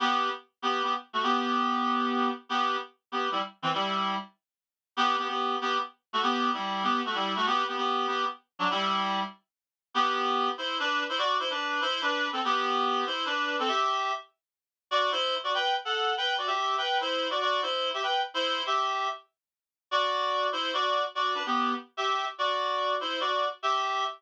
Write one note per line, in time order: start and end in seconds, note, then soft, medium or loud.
0.00 0.29 B3 medium
0.00 0.29 G4 medium
0.62 0.82 B3 medium
0.62 0.82 G4 medium
0.83 0.93 B3 medium
0.83 0.93 G4 medium
1.13 1.22 A3 medium
1.13 1.22 F#4 medium
1.23 2.29 B3 medium
1.23 2.29 G4 medium
2.49 2.76 B3 medium
2.49 2.76 G4 medium
3.12 3.29 B3 medium
3.12 3.29 G4 medium
3.32 3.40 G3 medium
3.32 3.40 E4 medium
3.62 3.71 E3 medium
3.62 3.71 C4 medium
3.74 4.15 G3 medium
3.74 4.15 E4 medium
4.97 5.16 B3 medium
4.97 5.16 G4 loud
5.18 5.27 B3 medium
5.18 5.27 G4 medium
5.28 5.56 B3 medium
5.28 5.56 G4 medium
5.61 5.78 B3 medium
5.61 5.78 G4 medium
6.13 6.22 A3 medium
6.13 6.22 F#4 medium
6.23 6.50 B3 medium
6.23 6.50 G4 medium
6.54 6.83 G3 medium
6.54 6.83 E4 medium
6.83 7.01 B3 medium
6.83 7.01 G4 medium
7.05 7.15 A3 medium
7.05 7.15 F#4 medium
7.15 7.34 G3 medium
7.15 7.34 E4 medium
7.36 7.46 A3 medium
7.36 7.46 F#4 medium
7.46 7.64 B3 medium
7.46 7.64 G4 loud
7.68 7.76 B3 medium
7.68 7.76 G4 medium
7.77 8.07 B3 medium
7.77 8.07 G4 medium
8.07 8.25 B3 medium
8.07 8.25 G4 medium
8.59 8.69 F#3 medium
8.59 8.69 D4 medium
8.71 9.21 G3 medium
8.71 9.21 E4 loud
9.94 10.49 B3 medium
9.94 10.49 G4 medium
10.58 10.77 E4 medium
10.58 10.77 C5 medium
10.80 11.03 D4 medium
10.80 11.03 B4 medium
11.09 11.18 E4 medium
11.09 11.18 C5 medium
11.18 11.37 F#4 medium
11.18 11.37 D5 medium
11.39 11.49 E4 medium
11.39 11.49 C5 medium
11.50 11.80 D4 medium
11.50 11.80 B4 medium
11.81 12.01 E4 medium
11.81 12.01 C5 medium
12.02 12.28 D4 medium
12.02 12.28 B4 medium
12.33 12.41 C4 medium
12.33 12.41 A4 medium
12.45 13.04 B3 medium
12.45 13.04 G4 medium
13.06 13.25 E4 medium
13.06 13.25 C5 medium
13.26 13.56 D4 medium
13.26 13.56 B4 medium
13.59 13.69 C4 medium
13.59 13.69 A4 medium
13.68 14.12 G4 medium
13.68 14.12 E5 medium
14.91 15.11 F#4 medium
14.91 15.11 D5 medium
15.12 15.35 E4 medium
15.12 15.35 C5 medium
15.44 15.53 F#4 medium
15.44 15.53 D5 medium
15.54 15.74 B4 medium
15.54 15.74 G5 medium
15.85 16.13 A4 medium
15.85 16.13 F#5 medium
16.17 16.34 B4 medium
16.17 16.34 G5 medium
16.38 16.48 F#4 medium
16.38 16.48 D5 medium
16.47 16.76 G4 medium
16.47 16.76 E5 medium
16.78 16.98 B4 medium
16.78 16.98 G5 medium
17.01 17.28 E4 medium
17.01 17.28 C5 medium
17.30 17.40 F#4 medium
17.30 17.40 D5 medium
17.41 17.62 F#4 medium
17.41 17.62 D5 medium
17.62 17.89 E4 medium
17.62 17.89 C5 medium
17.94 18.02 G4 medium
17.94 18.02 E5 medium
18.03 18.21 B4 medium
18.03 18.21 G5 medium
18.34 18.62 E4 medium
18.34 18.62 C5 medium
18.66 19.08 G4 medium
18.66 19.08 E5 medium
19.91 20.47 F#4 medium
19.91 20.47 D5 medium
20.52 20.71 E4 medium
20.52 20.71 C5 medium
20.74 21.03 F#4 medium
20.74 21.03 D5 medium
21.15 21.34 F#4 medium
21.15 21.34 D5 medium
21.35 21.43 D4 medium
21.35 21.43 B4 medium
21.46 21.73 B3 medium
21.46 21.73 G4 medium
21.97 22.25 G4 medium
21.97 22.25 E5 medium
22.38 22.95 F#4 medium
22.38 22.95 D5 medium
23.00 23.19 E4 medium
23.00 23.19 C5 medium
23.20 23.46 F#4 medium
23.20 23.46 D5 medium
23.63 24.04 G4 medium
23.63 24.04 E5 medium